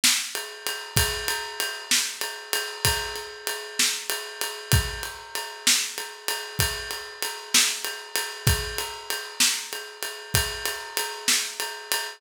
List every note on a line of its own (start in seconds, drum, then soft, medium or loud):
0.04 snare loud
0.35 ride medium
0.67 ride medium
0.96 kick loud
0.96 ride loud
1.28 ride medium
1.60 ride medium
1.91 snare loud
2.21 ride medium
2.53 ride medium
2.85 kick medium
2.85 ride loud
3.16 ride medium
3.47 ride medium
3.79 snare loud
4.10 ride medium
4.41 ride medium
4.72 kick loud
4.72 ride loud
5.03 ride medium
5.35 ride medium
5.67 snare loud
5.98 ride medium
6.28 ride medium
6.59 kick medium
6.59 ride loud
6.91 ride medium
7.23 ride medium
7.54 snare loud
7.54 ride medium
7.85 ride medium
8.16 ride medium
8.47 kick loud
8.47 ride loud
8.78 ride medium
9.10 ride medium
9.40 snare loud
9.73 ride medium
10.03 ride medium
10.34 kick medium
10.34 ride loud
10.65 ride medium
10.97 ride medium
11.28 snare loud
11.60 ride medium
11.92 ride medium